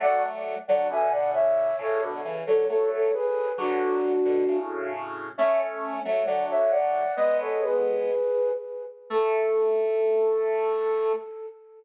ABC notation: X:1
M:2/2
L:1/8
Q:1/2=67
K:A
V:1 name="Flute"
[df] z2 [df] [eg] [df] [ce]2 | [Ac] z2 [Ac] [Ac] [Ac] [GB]2 | [DF]5 z3 | [ce] z2 [ce] [df] [ce] [df]2 |
"^rit." [B^d] [Ac] [GB]4 z2 | A8 |]
V:2 name="Lead 1 (square)"
[F,A,]3 [D,F,] [B,,D,]4 | [A,,C,] [B,,D,] [C,E,] [D,F,] [F,A,]2 z2 | [D,F,]3 [B,,D,] [A,,C,]4 | [A,C]3 [F,A,] [D,F,]4 |
"^rit." [G,B,]5 z3 | A,8 |]